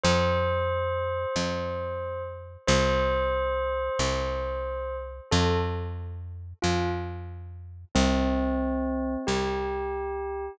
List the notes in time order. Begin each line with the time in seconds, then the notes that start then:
0.03 F2 C5
1.36 F2
2.67 C2 C5
3.99 C2
5.31 F2 A4
6.62 F2 F4
7.95 C2 C4
9.27 C2 G4